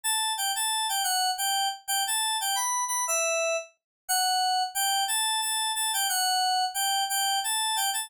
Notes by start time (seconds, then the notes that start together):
0.04 A5
0.37 G5
0.55 A5
0.89 G5
1.04 F#5
1.38 G5
1.88 G5
2.07 A5
2.41 G5
2.55 B5
2.88 B5
3.07 E5
4.08 F#5
4.75 G5
5.08 A5
5.41 A5
5.75 A5
5.93 G5
6.09 F#5
6.74 G5
7.09 G5
7.44 A5
7.76 G5
7.93 A5